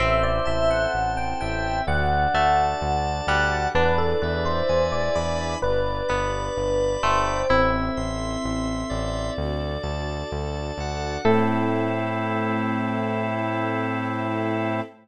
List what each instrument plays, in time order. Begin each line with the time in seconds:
0.00 synth bass 1 A1, pizzicato strings C4, string ensemble 1 C4 E4 A4, drawbar organ C5, electric piano 1 E5
0.23 electric piano 1 D5
0.45 synth bass 1 A1, electric piano 1 E5, drawbar organ A5
0.71 electric piano 1 F#5
0.92 synth bass 1 A1, drawbar organ C5
1.17 electric piano 1 G5
1.41 synth bass 1 A1, drawbar organ E5, electric piano 1 G5
1.87 synth bass 1 D2, string ensemble 1 D4 F#4 A4, drawbar organ D5, electric piano 1 F#5
2.34 synth bass 1 D2, pizzicato strings A3, drawbar organ A5
2.79 synth bass 1 D2, drawbar organ D5
3.27 synth bass 1 D2, pizzicato strings G3, drawbar organ F#5, electric piano 1 F#5
3.74 synth bass 1 E2, string ensemble 1 D4 E4 G#4 B4, pizzicato strings D4, electric piano 1 B4, drawbar organ D5
3.98 electric piano 1 A4
4.22 synth bass 1 E2, electric piano 1 B4, drawbar organ E5
4.45 electric piano 1 C5
4.69 synth bass 1 E2, drawbar organ G#5
4.92 electric piano 1 D5
5.15 synth bass 1 E2, electric piano 1 D5, drawbar organ B5
5.62 synth bass 1 G1, string ensemble 1 D4 G4 B4, electric piano 1 B4, drawbar organ D5
6.08 synth bass 1 G1, pizzicato strings B3, drawbar organ B5
6.57 synth bass 1 G1, drawbar organ D5
7.03 synth bass 1 G1, pizzicato strings A3, electric piano 1 C5, drawbar organ G5
7.49 synth bass 1 A1, electric piano 1 C4, pizzicato strings E4, string ensemble 1 E4 A4 C5, drawbar organ E5
7.97 synth bass 1 A1, drawbar organ C6
8.44 synth bass 1 A1, drawbar organ E5
8.90 synth bass 1 A1, drawbar organ D5
9.37 synth bass 1 D2, string ensemble 1 D4 F#4 A4
9.83 synth bass 1 D2, drawbar organ A5
10.32 synth bass 1 D2, drawbar organ D5
10.78 synth bass 1 D2, drawbar organ F#5
11.25 synth bass 1 A2, electric piano 1 A3, drawbar organ C4 E4 A4, string ensemble 1 C4 E4 A4, pizzicato strings A4